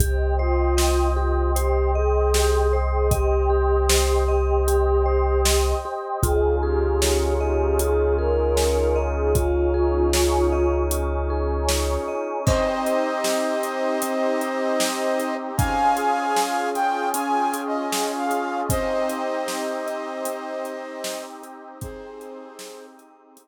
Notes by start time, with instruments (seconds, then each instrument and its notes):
0.00 synth bass 2 C2, vibraphone G4, choir aahs G4, pad 2 (warm) C5 D#5 G5, kick, closed hi-hat
0.39 choir aahs F4, vibraphone C5
0.77 vibraphone D#5, snare
1.16 choir aahs F4, vibraphone G4
1.56 choir aahs G4, vibraphone C5, closed hi-hat
1.94 choir aahs G#4, vibraphone D#5
2.34 vibraphone G4, snare
2.73 vibraphone C5
2.91 choir aahs G#4
3.11 choir aahs G4, vibraphone D#5, kick, closed hi-hat
3.50 vibraphone G4
3.89 vibraphone C5, snare
4.28 vibraphone D#5
4.67 vibraphone G4, closed hi-hat
5.06 vibraphone C5
5.45 vibraphone D#5, snare
5.85 vibraphone G4
6.23 synth bass 2 C#2, pad 2 (warm) C#4 D#4 F4 G#4, vibraphone F4, choir aahs G#4, kick, closed hi-hat
6.63 choir aahs G4, vibraphone G#4
7.02 vibraphone C#5, snare
7.40 choir aahs G4, vibraphone D#5
7.79 vibraphone F4, choir aahs G#4, closed hi-hat
8.17 vibraphone G#4, choir aahs A#4
8.57 vibraphone C#5, snare
8.96 vibraphone D#5
9.16 choir aahs G#4
9.35 pad 2 (warm) C#4 D#4 G#4 C#5, vibraphone F4, choir aahs F4, kick, closed hi-hat
9.74 vibraphone G#4
10.13 vibraphone C#5, snare
10.52 vibraphone D#5
10.91 vibraphone F4, closed hi-hat
11.30 vibraphone G#4
11.68 vibraphone C#5, snare
12.08 vibraphone D#5
12.45 pad 2 (warm) C4 D#4 G4, vibraphone C4, flute C5 D#5, kick, crash
12.85 vibraphone D#5, closed hi-hat
13.24 vibraphone G4, snare
13.63 vibraphone D#5, closed hi-hat
14.02 vibraphone C4, closed hi-hat
14.41 vibraphone D#5, closed hi-hat
14.80 vibraphone D#5, snare
15.19 vibraphone G4, closed hi-hat
15.57 vibraphone C#4, pad 2 (warm) C#4 F4 G#4, flute F5 G#5, kick, closed hi-hat
15.97 vibraphone G#4, closed hi-hat
16.36 vibraphone F4, snare
16.75 vibraphone G#4, flute G5, closed hi-hat
17.14 vibraphone C#4, flute G#5, closed hi-hat
17.54 vibraphone G#4, closed hi-hat
17.67 flute D#5
17.92 vibraphone G#4, snare
18.18 flute F5
18.31 vibraphone F4, closed hi-hat
18.69 pad 2 (warm) C4 D#4 G4, vibraphone C4, flute C5 D#5, kick, closed hi-hat
19.09 vibraphone D#5, closed hi-hat
19.47 vibraphone G4, snare
19.86 vibraphone D#5, closed hi-hat
20.25 vibraphone C4, closed hi-hat
20.65 vibraphone D#5, closed hi-hat
21.04 vibraphone D#5, snare
21.43 vibraphone G4, closed hi-hat
21.81 pad 2 (warm) C4 D#4 G4, vibraphone C4, flute G#4 C5, kick, closed hi-hat
22.20 vibraphone D#5, closed hi-hat
22.59 vibraphone G4, snare
22.98 vibraphone D#5, closed hi-hat
23.37 vibraphone C4, closed hi-hat